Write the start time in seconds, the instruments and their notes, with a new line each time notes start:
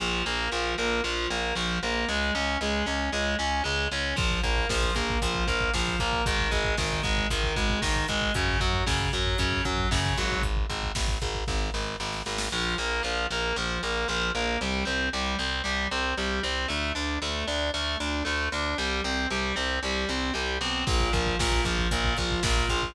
0.00 electric bass (finger) A#1, overdriven guitar F3
0.26 electric bass (finger) A#1, overdriven guitar A#3
0.52 electric bass (finger) A#1, overdriven guitar F3
0.78 electric bass (finger) A#1, overdriven guitar A#3
1.04 electric bass (finger) A#1, overdriven guitar F3
1.30 electric bass (finger) A#1, overdriven guitar A#3
1.55 electric bass (finger) A#1, overdriven guitar F3
1.83 electric bass (finger) A#1, overdriven guitar A#3
2.08 electric bass (finger) C#2, overdriven guitar G#3
2.35 electric bass (finger) C#2, overdriven guitar C#4
2.61 electric bass (finger) C#2, overdriven guitar G#3
2.86 electric bass (finger) C#2, overdriven guitar C#4
3.12 electric bass (finger) C#2, overdriven guitar G#3
3.39 electric bass (finger) C#2, overdriven guitar C#4
3.64 electric bass (finger) C#2, overdriven guitar G#3
3.92 electric bass (finger) C#2, overdriven guitar C#4
4.16 electric bass (finger) A#1, overdriven guitar F3, kick, crash
4.31 kick
4.43 electric bass (finger) A#1, overdriven guitar A#3, kick, closed hi-hat
4.57 kick
4.69 electric bass (finger) A#1, overdriven guitar F3, kick, snare
4.82 kick
4.95 electric bass (finger) A#1, overdriven guitar A#3, kick, closed hi-hat
5.10 kick
5.22 electric bass (finger) A#1, overdriven guitar F3, kick, closed hi-hat
5.34 kick
5.47 electric bass (finger) A#1, overdriven guitar A#3, kick, closed hi-hat
5.61 kick
5.74 electric bass (finger) A#1, overdriven guitar F3, kick, snare
5.88 kick
5.99 electric bass (finger) A#1, overdriven guitar A#3, kick, closed hi-hat
6.13 kick
6.26 electric bass (finger) G#1, overdriven guitar D#3, kick, closed hi-hat
6.39 kick
6.51 electric bass (finger) G#1, overdriven guitar G#3, kick, closed hi-hat
6.64 kick
6.77 electric bass (finger) G#1, overdriven guitar D#3, kick, snare
6.92 kick
7.03 electric bass (finger) G#1, overdriven guitar G#3, kick, closed hi-hat
7.17 kick
7.30 electric bass (finger) G#1, overdriven guitar D#3, kick, closed hi-hat
7.44 kick
7.56 electric bass (finger) G#1, overdriven guitar G#3, kick, closed hi-hat
7.70 kick
7.82 electric bass (finger) G#1, overdriven guitar D#3, kick, snare
7.96 kick
8.08 electric bass (finger) G#1, overdriven guitar G#3, kick, closed hi-hat
8.22 kick
8.34 electric bass (finger) F#2, overdriven guitar C#3, kick, closed hi-hat
8.48 kick
8.60 electric bass (finger) F#2, overdriven guitar F#3, kick, closed hi-hat
8.73 kick
8.86 electric bass (finger) F#2, overdriven guitar C#3, kick, snare
9.00 kick
9.13 electric bass (finger) F#2, overdriven guitar F#3, kick, closed hi-hat
9.26 kick
9.38 electric bass (finger) F#2, overdriven guitar C#3, kick, closed hi-hat
9.52 kick
9.65 electric bass (finger) F#2, overdriven guitar F#3, kick, closed hi-hat
9.78 kick
9.91 electric bass (finger) F#2, overdriven guitar C#3, kick, snare
10.06 kick
10.17 electric bass (finger) G#1, overdriven guitar F#3, kick, closed hi-hat
10.31 kick
10.43 kick, closed hi-hat
10.57 kick
10.70 electric bass (finger) G#1, kick, closed hi-hat
10.83 kick
10.95 electric bass (finger) G#1, kick, snare
11.08 kick
11.22 electric bass (finger) G#1, kick, closed hi-hat
11.35 kick
11.47 electric bass (finger) G#1, kick, snare
11.74 electric bass (finger) G#1, snare
12.00 electric bass (finger) G#1, snare
12.12 snare
12.26 electric bass (finger) G#1, snare
12.38 snare
12.52 electric bass (finger) A#1, overdriven guitar F3
12.78 electric bass (finger) A#1, overdriven guitar A#3
13.03 electric bass (finger) A#1, overdriven guitar F3
13.31 electric bass (finger) A#1, overdriven guitar A#3
13.56 electric bass (finger) A#1, overdriven guitar F3
13.83 electric bass (finger) A#1, overdriven guitar A#3
14.08 electric bass (finger) A#1, overdriven guitar F3
14.35 electric bass (finger) A#1, overdriven guitar A#3
14.61 electric bass (finger) C2, overdriven guitar G3
14.85 electric bass (finger) C2, overdriven guitar C4
15.13 electric bass (finger) C2, overdriven guitar G3
15.39 electric bass (finger) C2, overdriven guitar C4
15.64 electric bass (finger) C2, overdriven guitar G3
15.91 electric bass (finger) C2, overdriven guitar C4
16.17 electric bass (finger) C2, overdriven guitar G3
16.43 electric bass (finger) C2, overdriven guitar C4
16.68 electric bass (finger) D2, overdriven guitar A3
16.95 electric bass (finger) D2, overdriven guitar D4
17.22 electric bass (finger) D2, overdriven guitar A3
17.47 electric bass (finger) D2, overdriven guitar D4
17.74 electric bass (finger) D2, overdriven guitar A3
18.00 electric bass (finger) D2, overdriven guitar D4
18.25 electric bass (finger) D2, overdriven guitar A3
18.52 electric bass (finger) D2, overdriven guitar D4
18.78 electric bass (finger) C2, overdriven guitar G3
19.04 electric bass (finger) C2, overdriven guitar C4
19.30 electric bass (finger) C2, overdriven guitar G3
19.56 electric bass (finger) C2, overdriven guitar C4
19.83 electric bass (finger) C2, overdriven guitar G3
20.09 electric bass (finger) C2, overdriven guitar C4
20.34 electric bass (finger) C2, overdriven guitar G3
20.61 electric bass (finger) B1, overdriven guitar C4
20.87 electric bass (finger) A#1, overdriven guitar A#2, kick, crash
21.00 kick
21.13 electric bass (finger) A#1, overdriven guitar F3, kick, closed hi-hat
21.26 kick
21.39 electric bass (finger) A#1, overdriven guitar A#2, kick, snare
21.52 kick
21.65 electric bass (finger) A#1, overdriven guitar F3, kick, closed hi-hat
21.78 kick
21.91 electric bass (finger) A#1, overdriven guitar A#2, kick, closed hi-hat
22.04 kick
22.17 electric bass (finger) A#1, overdriven guitar F3, kick, closed hi-hat
22.31 kick
22.43 electric bass (finger) A#1, overdriven guitar A#2, kick, snare
22.57 kick
22.69 electric bass (finger) A#1, overdriven guitar F3, kick, closed hi-hat
22.82 kick